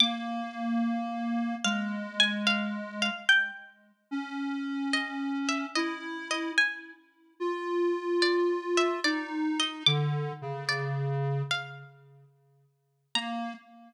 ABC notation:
X:1
M:4/4
L:1/8
Q:"Swing" 1/4=73
K:Bb
V:1 name="Harpsichord"
d' z3 f _a f f | g z3 e _f e e | _a z3 d =e d _e | d'2 d z f2 z2 |
b2 z6 |]
V:2 name="Lead 1 (square)"
B,4 _A,4 | z2 _D4 =E2 | z2 F4 E2 | D, _D,3 z4 |
B,2 z6 |]